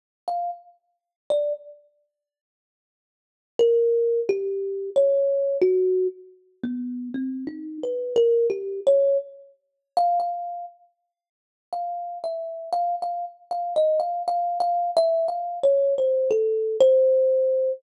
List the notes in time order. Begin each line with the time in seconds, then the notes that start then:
0.28 F5
1.30 D5
3.59 A#4
4.29 G4
4.96 C#5
5.62 F#4
6.64 B3
7.14 C4
7.47 D#4
7.83 B4
8.16 A#4
8.50 G4
8.87 C#5
9.97 F5
10.20 F5
11.73 F5
12.24 E5
12.73 F5
13.02 F5
13.51 F5
13.76 D#5
14.00 F5
14.28 F5
14.60 F5
14.97 E5
15.28 F5
15.64 C#5
15.98 C5
16.31 A4
16.81 C5